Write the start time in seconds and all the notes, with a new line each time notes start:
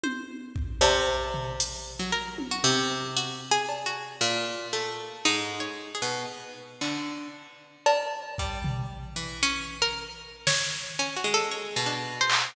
0.03 C5, high tom
0.56 kick
0.81 C3 C#4, cowbell
1.34 floor tom
1.60 closed hi-hat
1.99 F#3
2.12 A#4
2.38 high tom
2.51 F#4
2.64 C3
3.17 F#4, closed hi-hat
3.51 G#4
3.69 cowbell
3.86 F#4
4.21 A#2
4.73 A3
5.25 G#2 D#4
5.60 C#5
5.95 G#4
6.02 B2
6.81 D3, clap
7.86 A#4, cowbell
8.38 G3, kick
8.64 floor tom
9.16 E3
9.43 C#4
9.82 A#4
10.47 C#5, snare
10.99 C#4
11.16 F#4
11.24 G#3
11.34 A4
11.51 C#5
11.76 B2
11.86 D4
12.21 C5
12.30 clap